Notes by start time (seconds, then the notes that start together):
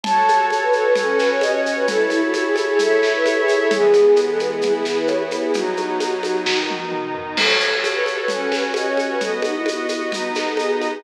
0.04 F#4 A4 C#5 A5, low conga, shaker
0.28 high conga, shaker
0.50 high conga, shaker
0.63 B4
0.73 A4, shaker
0.83 B4
0.96 C#4 F#4 A4 C#5, low conga, shaker
1.08 A4
1.19 B4, snare, shaker
1.32 C#5
1.41 D#5, high conga, shaker
1.52 C#5
1.66 shaker
1.75 B4
1.88 E4 A4 C#5, low conga, shaker
2.10 E4, high conga, shaker
2.24 F#4
2.34 F#4, high conga, shaker
2.45 G#4
2.56 F#4, high conga, shaker
2.68 G#4
2.79 E4 A4 C#5 E5, low conga, shaker
3.03 snare, shaker
3.16 B4
3.26 A4, high conga, shaker
3.40 G#4
3.48 high conga, shaker
3.57 A4
3.71 E3 G#3 B3 G#4, low conga, shaker
3.93 high conga, shaker
4.16 high conga, shaker
4.29 A4
4.38 B4, high conga, shaker
4.53 G#4
4.61 E3 B3 E4 G#4, low conga, shaker
4.73 G#4
4.85 G#4, snare, shaker
4.98 B4
5.07 C#5, high conga, shaker
5.20 B4
5.31 high conga, shaker
5.42 G#4
5.54 B2 F#3 D#4 F#4, low conga, shaker
5.77 high conga, shaker
6.00 high conga, shaker
6.23 high conga, shaker
6.46 B2 D#3 D#4, kick, snare
6.70 high tom
6.92 mid tom
7.15 floor tom
7.37 F#4 A4 C#5, crash, low conga, shaker
7.60 shaker
7.84 high conga, shaker
7.94 B4
8.06 A4, high conga, shaker
8.19 B4
8.28 C#4 F#4 A4 C#5, low conga, shaker
8.39 A4
8.52 B4, snare, high conga, shaker
8.63 C#5
8.74 D#5, high conga, shaker
8.89 C#5
8.97 high conga, shaker
9.10 B4
9.21 B3 F#4 A4 D#5, low conga, shaker
9.42 D#4, high conga, shaker
9.55 E4
9.66 E4, high conga, shaker
9.76 F#4
9.89 E4, high conga, shaker
9.99 F#4
10.12 B3 D#4 F#4 D#5, low conga, shaker
10.35 snare, high conga, shaker
10.47 A4
10.57 G#4, high conga, shaker
10.74 F#4
10.81 high conga, shaker
10.89 G#4